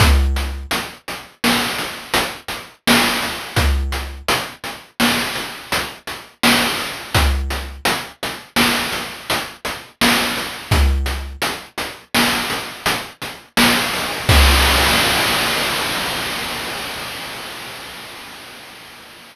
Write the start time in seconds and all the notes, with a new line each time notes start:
0.00 kick, closed hi-hat
0.36 closed hi-hat
0.71 closed hi-hat
1.08 closed hi-hat
1.44 snare
1.79 closed hi-hat
2.14 closed hi-hat
2.48 closed hi-hat
2.87 snare
3.22 closed hi-hat
3.56 kick, closed hi-hat
3.92 closed hi-hat
4.28 closed hi-hat
4.64 closed hi-hat
5.00 snare
5.35 closed hi-hat
5.72 closed hi-hat
6.07 closed hi-hat
6.43 snare
6.79 closed hi-hat
7.15 kick, closed hi-hat
7.50 closed hi-hat
7.85 closed hi-hat
8.23 closed hi-hat
8.56 snare
8.92 closed hi-hat
9.30 closed hi-hat
9.65 closed hi-hat
10.01 snare
10.37 closed hi-hat
10.71 kick, closed hi-hat
11.06 closed hi-hat
11.42 closed hi-hat
11.78 closed hi-hat
12.14 snare
12.50 closed hi-hat
12.86 closed hi-hat
13.22 closed hi-hat
13.57 snare
13.93 open hi-hat
14.29 kick, crash